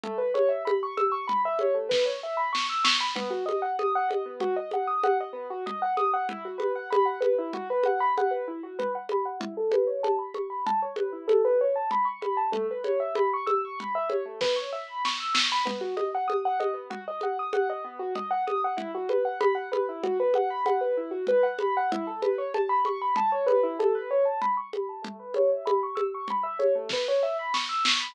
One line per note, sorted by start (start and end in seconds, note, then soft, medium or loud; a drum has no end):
0.04 0.18 A3 medium
0.04 low conga loud
0.18 0.32 B4 medium
0.34 0.48 C#5 medium
0.34 high conga medium
0.49 0.63 E5 medium
0.65 0.79 B5 medium
0.65 high conga loud
0.83 0.97 C#6 medium
0.97 1.11 E6 medium
0.97 high conga medium
1.12 1.26 C#6 medium
1.27 1.42 B5 medium
1.27 low conga medium
1.45 1.59 E5 medium
1.59 1.75 C#5 medium
1.59 high conga medium
1.74 1.88 A3 medium
1.89 2.03 B4 medium
1.89 kick medium
1.89 snare medium
2.06 2.20 C#5 medium
2.23 2.37 E5 medium
2.37 2.51 B5 medium
2.53 2.67 C#6 medium
2.53 snare loud
2.70 2.84 E6 medium
2.84 2.98 C#6 medium
2.84 snare loud
3.00 3.14 B5 medium
3.15 3.30 B3 medium
3.15 low conga loud
3.30 3.44 F#4 medium
3.46 3.60 D#5 medium
3.46 high conga medium
3.62 3.76 F#5 medium
3.79 3.93 D#6 medium
3.79 high conga medium
3.95 4.09 F#5 medium
4.09 4.23 D#5 medium
4.09 high conga medium
4.26 4.40 B3 medium
4.40 4.55 F#4 medium
4.40 low conga loud
4.56 4.70 D#5 medium
4.71 4.88 F#5 medium
4.71 high conga medium
4.87 5.01 D#6 medium
5.03 5.18 F#5 medium
5.03 high conga loud
5.20 5.35 D#5 medium
5.33 5.47 B3 medium
5.50 5.64 F#4 medium
5.66 5.80 D#5 medium
5.66 low conga loud
5.82 5.96 F#5 medium
5.97 6.11 D#6 medium
5.97 high conga medium
6.13 6.27 F#5 medium
6.29 6.44 E4 medium
6.29 low conga loud
6.45 6.59 F#4 medium
6.58 6.72 B4 medium
6.58 high conga medium
6.75 6.89 F#5 medium
6.90 7.05 B5 medium
6.90 high conga loud
7.05 7.20 F#5 medium
7.21 7.35 B4 medium
7.21 high conga medium
7.38 7.52 E4 medium
7.53 7.68 F#4 medium
7.53 low conga medium
7.70 7.84 B4 medium
7.83 8.00 F#5 medium
7.83 high conga medium
8.00 8.14 B5 medium
8.18 8.32 F#5 medium
8.18 high conga medium
8.31 8.45 B4 medium
8.48 8.62 E4 medium
8.63 8.77 F#4 medium
8.79 8.93 B4 medium
8.79 low conga medium
8.95 9.09 F#5 medium
9.09 9.26 B5 medium
9.09 high conga medium
9.25 9.39 F#5 medium
9.40 9.54 E4 medium
9.40 low conga loud
9.57 9.71 A4 medium
9.72 9.87 B4 medium
9.72 high conga medium
9.87 10.01 C#5 medium
10.03 10.17 A5 medium
10.03 high conga medium
10.19 10.33 B5 medium
10.34 10.49 C#6 medium
10.34 high conga medium
10.50 10.64 B5 medium
10.66 10.80 A5 medium
10.66 low conga loud
10.82 10.96 C#5 medium
10.96 11.10 B4 medium
10.96 high conga medium
11.13 11.27 E4 medium
11.28 11.42 A4 medium
11.28 high conga loud
11.45 11.59 B4 medium
11.61 11.75 C#5 medium
11.76 11.90 A5 medium
11.91 12.06 B5 medium
11.91 low conga medium
12.05 12.19 C#6 medium
12.21 12.35 B5 medium
12.21 high conga medium
12.37 12.51 A5 medium
12.52 12.66 A3 medium
12.52 low conga loud
12.71 12.85 B4 medium
12.84 12.98 C#5 medium
12.84 high conga medium
13.00 13.14 E5 medium
13.15 13.30 B5 medium
13.15 high conga loud
13.33 13.48 C#6 medium
13.46 13.61 E6 medium
13.46 high conga medium
13.65 13.79 C#6 medium
13.79 13.93 B5 medium
13.79 low conga medium
13.95 14.09 E5 medium
14.09 14.23 C#5 medium
14.09 high conga medium
14.25 14.39 A3 medium
14.41 14.55 B4 medium
14.41 kick medium
14.41 snare medium
14.56 14.70 C#5 medium
14.73 14.87 E5 medium
14.88 15.02 B5 medium
15.05 15.19 C#6 medium
15.05 snare loud
15.20 15.34 E6 medium
15.34 15.48 C#6 medium
15.34 snare loud
15.52 15.66 B5 medium
15.65 15.79 B3 medium
15.65 low conga loud
15.81 15.95 F#4 medium
15.97 16.11 D#5 medium
15.97 high conga medium
16.15 16.29 F#5 medium
16.28 16.42 D#6 medium
16.28 high conga medium
16.45 16.59 F#5 medium
16.60 16.74 D#5 medium
16.60 high conga medium
16.74 16.88 B3 medium
16.90 17.04 F#4 medium
16.90 low conga loud
17.08 17.22 D#5 medium
17.21 17.37 F#5 medium
17.21 high conga medium
17.39 17.53 D#6 medium
17.53 17.68 F#5 medium
17.53 high conga loud
17.70 17.84 D#5 medium
17.84 17.98 B3 medium
17.99 18.13 F#4 medium
18.15 18.29 D#5 medium
18.15 low conga loud
18.31 18.45 F#5 medium
18.47 18.61 D#6 medium
18.47 high conga medium
18.64 18.78 F#5 medium
18.77 18.91 E4 medium
18.77 low conga loud
18.95 19.09 F#4 medium
19.09 19.24 B4 medium
19.09 high conga medium
19.25 19.39 F#5 medium
19.40 19.55 B5 medium
19.40 high conga loud
19.55 19.69 F#5 medium
19.72 19.86 B4 medium
19.72 high conga medium
19.89 20.03 E4 medium
20.03 20.17 F#4 medium
20.03 low conga medium
20.20 20.34 B4 medium
20.34 20.49 F#5 medium
20.34 high conga medium
20.50 20.64 B5 medium
20.66 20.80 F#5 medium
20.66 high conga medium
20.81 20.95 B4 medium
20.97 21.11 E4 medium
21.11 21.25 F#4 medium
21.27 21.42 B4 medium
21.27 low conga medium
21.43 21.57 F#5 medium
21.59 21.74 B5 medium
21.59 high conga medium
21.77 21.91 F#5 medium
21.92 22.06 E4 medium
21.92 low conga loud
22.07 22.21 A4 medium
22.22 22.36 B4 medium
22.22 high conga medium
22.38 22.52 C#5 medium
22.54 22.68 A5 medium
22.54 high conga medium
22.69 22.83 B5 medium
22.85 23.00 C#6 medium
22.85 high conga medium
23.02 23.16 B5 medium
23.16 23.31 A5 medium
23.16 low conga loud
23.32 23.46 C#5 medium
23.46 23.61 B4 medium
23.46 high conga medium
23.63 23.77 E4 medium
23.79 23.93 A4 medium
23.79 high conga loud
23.95 24.09 B4 medium
24.11 24.25 C#5 medium
24.25 24.39 A5 medium
24.42 24.56 B5 medium
24.42 low conga medium
24.57 24.71 C#6 medium
24.73 24.87 B5 medium
24.73 high conga medium
24.89 25.03 A5 medium
25.02 25.16 A3 medium
25.02 low conga loud
25.19 25.33 B4 medium
25.34 25.50 C#5 medium
25.34 high conga medium
25.52 25.66 E5 medium
25.65 25.80 B5 medium
25.65 high conga loud
25.83 25.97 C#6 medium
25.95 26.10 E6 medium
25.95 high conga medium
26.14 26.29 C#6 medium
26.28 26.44 B5 medium
26.28 low conga medium
26.43 26.57 E5 medium
26.59 26.73 C#5 medium
26.59 high conga medium
26.75 26.89 A3 medium
26.89 27.07 B4 medium
26.89 kick medium
26.89 snare medium
27.08 27.22 C#5 medium
27.23 27.37 E5 medium
27.39 27.53 B5 medium
27.54 27.68 C#6 medium
27.54 snare loud
27.69 27.83 E6 medium
27.84 27.98 C#6 medium
27.84 snare loud
28.00 28.14 B5 medium